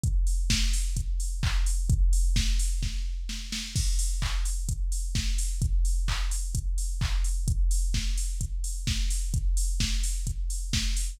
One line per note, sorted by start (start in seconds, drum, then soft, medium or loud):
0.03 kick medium
0.03 closed hi-hat medium
0.27 open hi-hat medium
0.50 kick medium
0.50 snare loud
0.73 open hi-hat medium
0.97 kick medium
0.97 closed hi-hat medium
1.20 open hi-hat medium
1.43 kick medium
1.43 clap loud
1.66 open hi-hat medium
1.90 kick loud
1.90 closed hi-hat medium
2.13 open hi-hat medium
2.36 kick medium
2.36 snare loud
2.59 open hi-hat medium
2.83 kick medium
2.83 snare medium
3.29 snare medium
3.52 snare medium
3.76 kick medium
3.76 crash medium
3.99 open hi-hat medium
4.22 kick medium
4.22 clap medium
4.45 open hi-hat medium
4.69 kick medium
4.69 closed hi-hat loud
4.92 open hi-hat medium
5.15 kick medium
5.15 snare medium
5.38 open hi-hat medium
5.62 kick medium
5.62 closed hi-hat medium
5.85 open hi-hat medium
6.08 kick medium
6.08 clap loud
6.31 open hi-hat medium
6.55 kick medium
6.55 closed hi-hat loud
6.78 open hi-hat medium
7.01 kick medium
7.01 clap medium
7.24 open hi-hat medium
7.48 kick medium
7.48 closed hi-hat medium
7.71 open hi-hat medium
7.94 kick medium
7.94 snare medium
8.17 open hi-hat medium
8.41 kick medium
8.41 closed hi-hat medium
8.64 open hi-hat medium
8.87 kick medium
8.87 snare medium
9.10 open hi-hat medium
9.34 kick medium
9.34 closed hi-hat medium
9.57 open hi-hat medium
9.80 kick medium
9.80 snare loud
10.03 open hi-hat medium
10.27 kick medium
10.27 closed hi-hat medium
10.50 open hi-hat medium
10.73 kick medium
10.73 snare loud
10.97 open hi-hat medium